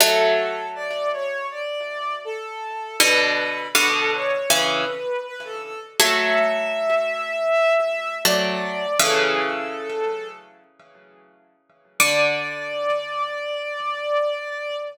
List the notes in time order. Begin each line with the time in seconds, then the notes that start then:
0.00 F#3 A3 A4
0.75 D5
1.13 C#5
1.50 D5
2.25 A4
3.00 B2 D3 B4
3.75 B2 D3 B4
3.94 A4
4.13 C#5
4.49 C#3 E3 B4
5.25 B4
5.44 A4
5.62 A4
6.00 F#3 A3 E5
8.25 F#3 A3 D5
8.99 C#3 E3 A4
12.00 D3 D5